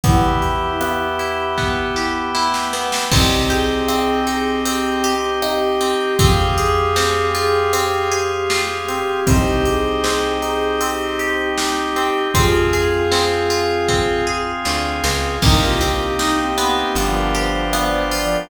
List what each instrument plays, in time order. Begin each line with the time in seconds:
0.04 electric bass (finger) E2, pad 5 (bowed) B3 E4 G4, acoustic guitar (steel) B3, drawbar organ B3 E4 G4, brass section E4, ocarina E4 G4, kick, closed hi-hat
0.42 acoustic guitar (steel) G4, closed hi-hat
0.81 acoustic guitar (steel) B3, cross-stick
1.19 acoustic guitar (steel) E4, closed hi-hat
1.58 pad 5 (bowed) B3 G4 B4, acoustic guitar (steel) B3, kick, snare
1.96 acoustic guitar (steel) G4, snare
2.35 acoustic guitar (steel) E4, snare
2.54 snare
2.73 acoustic guitar (steel) B3, snare
2.92 snare
3.11 electric bass (finger) C2, pad 5 (bowed) C4 D#4 G4, acoustic guitar (steel) C4, brass section C4, drawbar organ C4 D#4 G4, ocarina G4, kick, crash
3.49 acoustic guitar (steel) G4, ocarina G#4, closed hi-hat
3.88 acoustic guitar (steel) C4, cross-stick
4.27 acoustic guitar (steel) D#4, ocarina G#4, closed hi-hat
4.65 acoustic guitar (steel) C4, ocarina G4, closed hi-hat
5.04 acoustic guitar (steel) G4, closed hi-hat
5.42 acoustic guitar (steel) D#4, ocarina G4, cross-stick
5.81 acoustic guitar (steel) C4, closed hi-hat
6.17 electric bass (finger) F2, drawbar organ C4 F4 G#4, acoustic guitar (steel) C4, pad 5 (bowed) C4 F4 G#4, ocarina G4, brass section G4, kick, closed hi-hat
6.56 ocarina G#4, acoustic guitar (steel) G#4, closed hi-hat
6.96 acoustic guitar (steel) C4, snare
7.35 acoustic guitar (steel) F4, ocarina G#4, closed hi-hat
7.73 acoustic guitar (steel) C4, ocarina G4, closed hi-hat
8.12 acoustic guitar (steel) G#4, closed hi-hat
8.49 acoustic guitar (steel) F4, ocarina G4, snare
8.88 acoustic guitar (steel) C4, closed hi-hat
9.26 electric bass (finger) C2, drawbar organ C4 D#4 G4, acoustic guitar (steel) C4, pad 5 (bowed) C4 D#4 G4, ocarina G4, brass section C5, kick, closed hi-hat
9.65 acoustic guitar (steel) G4, ocarina G#4, closed hi-hat
10.04 acoustic guitar (steel) C4, snare
10.42 acoustic guitar (steel) D#4, ocarina G#4, closed hi-hat
10.79 acoustic guitar (steel) C4, ocarina G4, closed hi-hat
11.19 acoustic guitar (steel) G4, closed hi-hat
11.58 acoustic guitar (steel) D#4, ocarina G4, snare
11.96 acoustic guitar (steel) C4, closed hi-hat
12.34 electric bass (finger) F2, drawbar organ C4 F4 G#4, acoustic guitar (steel) C4, pad 5 (bowed) C4 F4 G#4, ocarina F4 G#4, brass section F4, kick, closed hi-hat
12.73 acoustic guitar (steel) G#4, closed hi-hat
13.12 acoustic guitar (steel) C4, snare
13.50 acoustic guitar (steel) F4, closed hi-hat
13.88 acoustic guitar (steel) C4, kick, snare
14.27 acoustic guitar (steel) G#4
14.65 electric bass (finger) D2, acoustic guitar (steel) F4, snare
15.04 electric bass (finger) C#2, acoustic guitar (steel) C4, snare
15.42 electric bass (finger) C2, drawbar organ A#3 C4 D#4 G4, acoustic guitar (steel) A#3, pad 5 (bowed) A#3 C4 D#4 G4, brass section D#4, ocarina A#4, kick, crash
15.61 brass section F4, ocarina G4
15.81 acoustic guitar (steel) C4, closed hi-hat
16.19 brass section D#4, acoustic guitar (steel) D#4, snare
16.37 brass section C4, ocarina G4
16.57 acoustic guitar (steel) B3, brass section C4, closed hi-hat
16.77 ocarina G4
16.95 electric bass (finger) G1, brass section F3, pad 5 (bowed) B3 D4 F4 G4, drawbar organ B3 D4 F4 G4, closed hi-hat
17.14 ocarina A#4
17.35 acoustic guitar (steel) G4, ocarina C5, closed hi-hat
17.73 acoustic guitar (steel) B3, ocarina D5, cross-stick
17.92 ocarina C5
18.11 brass section F3, acoustic guitar (steel) F4, ocarina D5, open hi-hat
18.33 ocarina A#4